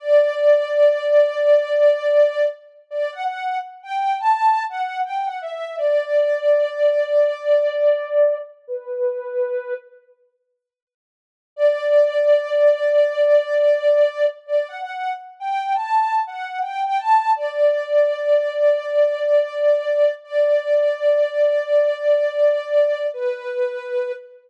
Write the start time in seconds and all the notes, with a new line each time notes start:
0.00 D5
2.91 D5
3.12 F#5
3.24 F#5
3.83 G5
4.20 A5
4.69 F#5
5.04 G5
5.26 F#5
5.42 E5
5.78 D5
8.67 B4
11.56 D5
14.47 D5
14.68 F#5
14.82 F#5
15.40 G5
15.75 A5
16.27 F#5
16.62 G5
16.84 G5
16.98 A5
17.36 D5
20.24 D5
23.14 B4